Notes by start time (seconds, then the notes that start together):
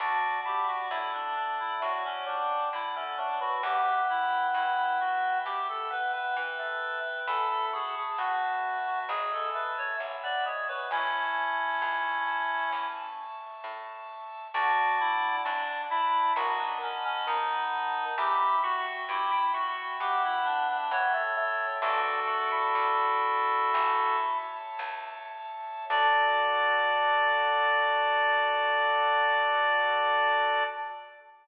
0.00 D2 D4 F#4 D5 F#5 A5
0.45 E4 G4
0.67 F#4
0.90 F#2 A3 E4
1.13 D4
1.36 D4
1.59 E4
1.82 A2 F#3 F#4
2.05 C#4
2.27 G3 D4
2.73 D3 E4
2.95 A3 C#4
3.17 F#3 D4
3.41 E3 F#4
3.63 E2 B3 G4 E5 G5 B5
4.09 E4
4.54 G2 E4
5.00 F#4
5.45 B2 G4
5.69 A4
5.90 B3 B4
6.13 B3 B4
6.37 E3 B4
6.59 A3
7.27 E2 E4 A4 E5 A5 B5
7.50 A4
7.73 F#4 G#4
7.96 G#4
8.18 A2 B3 F#4
8.87 F#4
9.09 G#1 G#3 G#4 E5 G#5 B5
9.32 A4
9.54 A3 B4
9.78 C#5
10.00 B1
10.23 B3 D5
10.46 G#3 C#5
10.68 F#3 B4
10.91 A1 C#4 E4 E5 A5 C#6
11.82 C#2
12.73 E2
13.64 A2
14.54 D2 D4 F#4 D5 F#5 A5
15.00 E4
15.45 F#2 D4
15.90 E4
16.36 B1 D#3 F#4 D#5 F#5 A5 B5
16.59 D4
16.82 C#4
17.04 C#4
17.27 D#2 D#3 D#4
18.18 E2 E4 G4 E5 G5 B5
18.63 F#4
19.09 G2 E4 G4
19.31 E4
19.54 F#4
20.00 B2 B3 G4
20.24 E4
20.45 D4
20.68 D4
20.91 E3 B3 C#5
21.14 A3
21.37 A3
21.82 A1 D4 F#4 A4 D5 E5 A5
22.27 F#4
22.52 E4
22.75 D2
23.74 A1 C#5 E5 A5
24.79 C#2
25.90 D2 D4 F#4 A4 D5